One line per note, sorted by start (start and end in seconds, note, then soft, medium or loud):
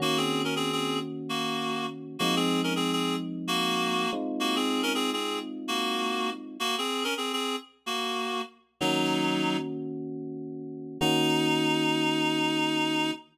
0.00 2.17 D#3 medium
0.00 2.17 A#3 medium
0.00 0.17 A#3 medium
0.00 2.17 C#4 medium
0.00 2.17 F#4 medium
0.00 0.17 F#4 medium
0.17 0.42 C4 medium
0.17 0.42 G#4 medium
0.44 0.54 C#4 medium
0.44 0.54 A#4 medium
0.56 0.72 C4 medium
0.56 0.72 G#4 medium
0.72 0.99 C4 medium
0.72 0.99 G#4 medium
1.29 1.86 A#3 medium
1.29 1.86 F#4 medium
2.19 4.06 F3 medium
2.19 4.06 G#3 medium
2.19 2.35 A#3 medium
2.19 4.06 C4 medium
2.19 4.06 D#4 medium
2.19 2.35 F#4 medium
2.36 2.61 C4 medium
2.36 2.61 G#4 medium
2.64 2.74 C#4 medium
2.64 2.74 A#4 medium
2.76 2.92 C4 medium
2.76 2.92 G#4 medium
2.92 3.16 C4 medium
2.92 3.16 G#4 medium
3.47 4.10 A#3 medium
3.47 4.10 F#4 medium
4.13 6.57 G#3 medium
4.13 6.57 C4 medium
4.13 6.57 D#4 medium
4.13 6.57 F4 medium
4.40 4.56 A#3 medium
4.40 4.56 F#4 medium
4.56 4.82 C4 medium
4.56 4.82 G#4 medium
4.83 4.93 C#4 medium
4.83 4.93 A#4 medium
4.95 5.11 C4 medium
4.95 5.11 G#4 medium
5.13 5.39 C4 medium
5.13 5.39 G#4 medium
5.68 6.30 A#3 medium
5.68 6.30 F#4 medium
6.60 6.76 A#3 medium
6.60 6.76 F#4 medium
6.78 7.04 C4 medium
6.78 7.04 G#4 medium
7.04 7.14 C#4 medium
7.04 7.14 A#4 medium
7.17 7.32 C4 medium
7.17 7.32 G#4 medium
7.33 7.56 C4 medium
7.33 7.56 G#4 medium
7.86 8.41 A#3 medium
7.86 8.41 F#4 medium
8.81 10.98 D#3 medium
8.81 9.57 F#3 medium
8.81 10.98 A#3 medium
8.81 10.98 C#4 medium
8.81 9.57 D#4 medium
8.81 10.98 F#4 medium
11.00 13.11 D#3 loud
11.00 13.11 A#3 loud
11.00 13.11 C#4 medium
11.00 13.11 D#4 loud
11.00 13.11 F#4 loud